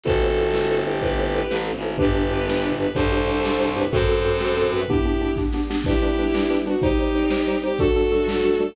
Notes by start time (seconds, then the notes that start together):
0.03 G1 A3 B3 C4 E4 F#4 A4 B4 C5, kick, closed hi-hat
0.22 E4 A4 B4 C5
0.30 closed hi-hat
0.38 E4 A4 B4 C5
0.54 E4 A4 B4 C5, snare
0.70 E4 A4 B4 C5
0.77 closed hi-hat
0.86 E4 G4 A4 B4 C5
1.02 E4 G4 A4 B4 C5, kick, closed hi-hat
1.19 E4 A4 B4 C5
1.26 closed hi-hat
1.34 E4 A4 B4 C5
1.50 A1 E4 A4 B4 C5, snare
1.67 E4 A4 B4 C5
1.76 G#1, closed hi-hat
1.83 E4 A4 B4 C5
1.98 G1 B3 D4 G4 B4, kick, floor tom
2.15 D4 G4 B4
2.23 floor tom
2.31 D4 G4 B4
2.47 D4 G4 B4, snare
2.63 D4 G4 B4
2.72 floor tom
2.79 D4 G4 B4
2.94 C2 C4 D4 G4 A4 C5, kick, floor tom
3.12 D4 G4 C5
3.19 floor tom
3.28 D4 G4 C5
3.44 D4 G4 C5, snare
3.60 D4 G4 C5
3.68 floor tom
3.76 D4 G4 B4 C5
3.91 F#2 C4 F#4 A4 C5, kick, floor tom
4.08 C4 F#4 A4
4.19 floor tom
4.25 C4 F#4 A4
4.40 C4 F#4 A4, snare
4.57 C4 F#4 A4
4.63 floor tom
4.73 C4 F#4 A4 B4
4.87 B3 D4 E4 G4, kick, floor tom
5.06 B3 D4 G4
5.13 floor tom
5.21 B3 D4 G4
5.36 B3 D4 G4, kick, snare
5.52 B3 D4 G4, snare
5.70 B3 D4 G4, snare
5.84 G3 B3 D4 E4 G4 B4, kick, crash
6.02 G3 D4 B4, closed hi-hat
6.18 G3 D4 B4, closed hi-hat
6.34 G3 D4 B4, snare
6.50 G3 D4 B4, closed hi-hat
6.67 G3 D4 F#4 B4, closed hi-hat
6.81 G3 C4 D#4 G4 C5, kick, closed hi-hat
6.99 G3 D#4 C5, closed hi-hat
7.15 G3 D#4 C5, closed hi-hat
7.30 G3 D#4 C5, snare
7.47 G3 D#4 C5, closed hi-hat
7.64 G3 D#4 G4 C5, closed hi-hat
7.78 G2 F#3 G3 A3 D4 F#4 A4, kick, closed hi-hat
7.95 G3 D4 F#4 A4, closed hi-hat
8.11 G3 D4 F#4 A4, closed hi-hat
8.28 G3 D4 F#4 A4, snare
8.44 G3 D4 F#4 A4, closed hi-hat
8.59 G3 D4 F#4 A4, closed hi-hat